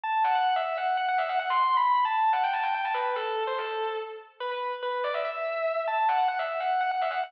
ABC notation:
X:1
M:7/8
L:1/16
Q:1/4=144
K:Em
V:1 name="Distortion Guitar"
a2 f f f e2 f2 f f e f f | (3c'4 b4 a4 f g a g g a | B2 A3 c A4 z4 | B B2 z B2 d e e6 |
a2 f f f e2 f2 f f e f f |]